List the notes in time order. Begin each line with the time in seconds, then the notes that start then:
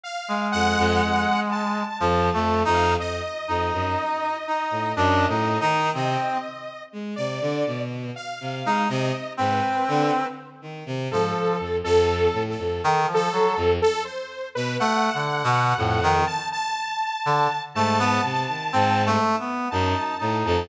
0.03 F5
0.28 G#3
0.52 F2 F#5
0.78 F2
1.03 F2
1.51 A5
2.00 F2 F3
2.33 F2 A3
2.65 F2 D#4
2.74 F5
2.99 F2 D#5
3.48 F2 D#4
3.73 F#2
4.47 D#4
4.71 A2
4.96 F#2 D4
5.28 A2 D#4
5.60 D#3 D#4
5.93 C3 C4 D#5
6.92 G#3
7.16 C3 D5
7.41 D3
7.66 B2
8.16 F5
8.40 C3
8.65 G#3 D#4
8.89 C3 D#5
9.37 G#2 C4 B4
9.88 D3
10.62 D#3
10.86 C3
11.10 G#2 F3 A4
11.59 F2
11.83 F2 A4
12.33 A2
12.49 A4
12.58 F2
12.84 D#3
13.06 F3
13.14 A4
13.32 F#3
13.57 F2
13.82 A4
14.05 C5
14.55 B2 B4
14.80 A3 F#5
15.13 D3
15.44 B2
15.77 F2 A2
16.03 D#3
16.27 A5
16.52 A5
17.25 D3
17.75 G#2 A3 A5
17.99 B3
18.23 C3
18.48 D#3
18.73 G#2 C4
19.06 A3
19.39 B3
19.71 F#2 D#4 A5
20.19 A2 D#4
20.45 F2 A5